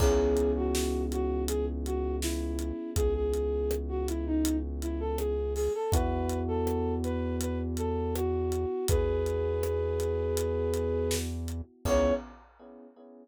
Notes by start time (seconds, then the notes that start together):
0.00 C#2 B3 C#4 E4 G#4, kick, crash
0.37 closed hi-hat
0.56 F#4
0.75 snare
1.12 F#4, closed hi-hat
1.48 G#4, closed hi-hat
1.85 F#4, closed hi-hat
2.22 E4, snare
2.59 closed hi-hat
2.96 C#2 G#4, kick, closed hi-hat
3.15 G#4
3.34 closed hi-hat
3.71 cross-stick
3.89 F#4
4.08 E4, closed hi-hat
4.26 D#4
4.45 closed hi-hat
4.82 E4, closed hi-hat
5.00 A4
5.18 G#4, cross-stick
5.55 G#4, open hi-hat
5.75 A4
5.92 E2 B3 E4 F#4 B4, kick, closed hi-hat
6.29 closed hi-hat
6.48 A4
6.67 cross-stick
7.04 B4, closed hi-hat
7.41 B4, closed hi-hat
7.77 A4, closed hi-hat
8.15 F#4, cross-stick
8.52 closed hi-hat
8.88 E2 G#4 B4, kick, closed hi-hat
9.26 closed hi-hat
9.63 cross-stick
10.00 closed hi-hat
10.37 closed hi-hat
10.74 closed hi-hat
11.11 snare
11.48 closed hi-hat
11.85 C#2 B3 C#4 E4 G#4 C#5, kick, crash